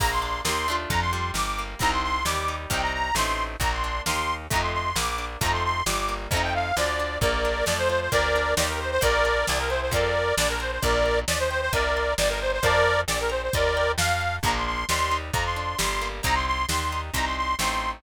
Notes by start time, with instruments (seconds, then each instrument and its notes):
0.00 electric bass (finger) A#1, orchestral harp A#3, accordion A#5, kick, crash
0.11 accordion C6
0.22 orchestral harp D4, accordion C6
0.45 electric bass (finger) D#2, orchestral harp A#3 D#4, accordion C6, snare
0.49 orchestral harp G4
0.68 orchestral harp A3 D4 F4
0.90 electric bass (finger) F2, accordion A#5, kick, closed hi-hat
1.01 accordion C6
1.13 orchestral harp G3, accordion C6
1.34 electric bass (finger) G1, accordion D6, snare
1.58 orchestral harp A#3
1.79 electric bass (finger) C2, orchestral harp G3 C4 D#4, accordion A#5, kick, closed hi-hat
1.92 accordion C6
2.03 accordion C6
2.25 electric bass (finger) D#2, orchestral harp G3, accordion D6, snare
2.48 orchestral harp D#4
2.70 electric bass (finger) C2, orchestral harp G3 C4 D#4, accordion G5, kick, closed hi-hat
2.82 accordion A#5
2.93 accordion A#5
3.15 electric bass (finger) A1, orchestral harp A3 C4, accordion C6, snare
3.19 orchestral harp D#4
3.60 electric bass (finger) A#1, orchestral harp A#3, accordion A#5, kick, closed hi-hat
3.72 accordion C6
3.84 orchestral harp D4, accordion C6
4.06 electric bass (finger) D#2, orchestral harp A#3 D#4 G4, accordion C6, snare
4.50 electric bass (finger) F2, orchestral harp A3 C4 D#4, accordion A#5, kick, closed hi-hat
4.56 orchestral harp F4
4.62 accordion C6
4.73 accordion C6
4.96 electric bass (finger) A#1, orchestral harp A#3, accordion D6, snare
5.18 orchestral harp D4
5.41 electric bass (finger) F2, orchestral harp A3 C4 D#4, accordion A#5, kick, closed hi-hat
5.46 orchestral harp F4
5.53 accordion C6
5.64 accordion C6
5.86 electric bass (finger) G1, orchestral harp G3, accordion D6, snare
6.09 orchestral harp A#3
6.31 electric bass (finger) F2, orchestral harp F3 A3, accordion A#5, kick, closed hi-hat
6.35 orchestral harp C4 D#4
6.43 accordion G5
6.54 accordion F5
6.77 electric bass (finger) D2, orchestral harp F3, accordion D5, snare
6.99 orchestral harp D4
7.21 electric bass (finger) A#1, orchestral harp A#3, accordion A#4 D5, kick, closed hi-hat
7.45 orchestral harp D4
7.66 electric bass (finger) F2, orchestral harp A3, accordion D5, snare
7.78 accordion C5
7.89 orchestral harp F4, accordion C5
8.01 accordion C5
8.12 electric bass (finger) D2, orchestral harp A#3, accordion A#4 D5, kick, closed hi-hat
8.36 orchestral harp D4
8.57 electric bass (finger) D#2, orchestral harp A#3 D#4 G4, accordion D5, snare
8.69 accordion A#4
8.80 accordion C5
8.91 accordion C5
9.01 electric bass (finger) A#1, orchestral harp A#3, accordion A#4 D5, kick, closed hi-hat
9.25 orchestral harp D4
9.47 electric bass (finger) C2, orchestral harp C4, accordion D5, snare
9.59 accordion A#4
9.70 orchestral harp E4, accordion C5
9.81 accordion C5
9.91 electric bass (finger) F2, orchestral harp C4 F4, accordion A#4 D5, kick, closed hi-hat
9.96 orchestral harp A4
10.37 electric bass (finger) A#1, orchestral harp D4, accordion D5, snare
10.49 accordion A#4
10.60 orchestral harp A#4, accordion C5
10.72 accordion C5
10.82 electric bass (finger) A#1, accordion A#4 D5, orchestral harp D5, kick, closed hi-hat
11.06 orchestral harp A#5
11.28 electric bass (finger) D#2, accordion D5, orchestral harp D#5, snare
11.39 accordion C5
11.51 accordion C5, orchestral harp G5
11.61 accordion C5
11.73 electric bass (finger) C2, accordion A#4 D5, orchestral harp D#5, kick, closed hi-hat
11.97 orchestral harp C6
12.18 electric bass (finger) G1, accordion D5, orchestral harp D5 G5 A#5, snare
12.29 accordion A#4
12.41 accordion C5
12.52 accordion C5
12.63 electric bass (finger) F2, accordion A#4 D5, orchestral harp C5 F5 A5, kick, closed hi-hat
13.08 electric bass (finger) A#1, accordion D5, orchestral harp D5, snare
13.20 accordion A#4
13.30 accordion C5, orchestral harp A#5
13.42 accordion C5
13.53 electric bass (finger) D#2, accordion A#4 D5, orchestral harp D#5, kick, closed hi-hat
13.77 orchestral harp G5
13.98 electric bass (finger) F2, accordion F5, orchestral harp F5, snare
14.21 orchestral harp A5
14.43 electric bass (finger) A#1, orchestral harp F3 A#3, accordion A#5, kick, closed hi-hat
14.48 orchestral harp D4
14.55 accordion C6
14.66 accordion C6
14.89 electric bass (finger) D#2, orchestral harp G3, accordion C6, snare
15.11 orchestral harp D#4
15.33 electric bass (finger) F2, orchestral harp F3, accordion A#5, kick, closed hi-hat
15.45 accordion C6
15.56 orchestral harp D4, accordion C6
15.78 electric bass (finger) G1, orchestral harp G3, accordion C6, snare
16.01 orchestral harp A#3
16.23 electric bass (finger) C2, orchestral harp G3 C4 D#4, accordion A#5, kick, closed hi-hat
16.35 accordion C6
16.47 accordion C6
16.69 electric bass (finger) D#2, orchestral harp G3, accordion C6, snare
16.92 orchestral harp D#4
17.14 electric bass (finger) C2, orchestral harp G3 C4, accordion A#5, kick, closed hi-hat
17.18 orchestral harp D#4
17.25 accordion C6
17.37 accordion C6
17.59 electric bass (finger) A1, orchestral harp A3 C4 D#4, accordion C6, snare